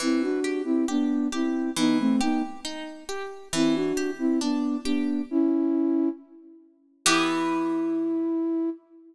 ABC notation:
X:1
M:2/4
L:1/16
Q:1/4=68
K:Em
V:1 name="Flute"
[CE] [DF]2 [CE] [B,D]2 [CE]2 | [B,^D] [A,C] [B,D] z5 | [CE] [DF]2 [CE] [B,D]2 [B,D]2 | [^CE]4 z4 |
E8 |]
V:2 name="Orchestral Harp"
E,2 G2 G2 G2 | E,2 G2 ^D2 G2 | E,2 G2 D2 G2 | z8 |
[E,B,G]8 |]